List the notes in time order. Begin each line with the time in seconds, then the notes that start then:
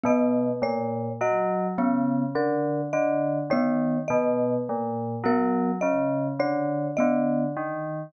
0.04 B2 B3 D#5
0.62 A#2 C#5
1.21 F#3 D#5
1.78 C#3 B3
2.35 D3 A#4
2.93 D3 D#5
3.50 D#3 B3 C#5
4.08 B2 D#5
4.69 A#2
5.24 F#3 B3 A#4
5.81 C#3 D#5
6.39 D3 C#5
6.97 D3 B3 D#5
7.56 D#3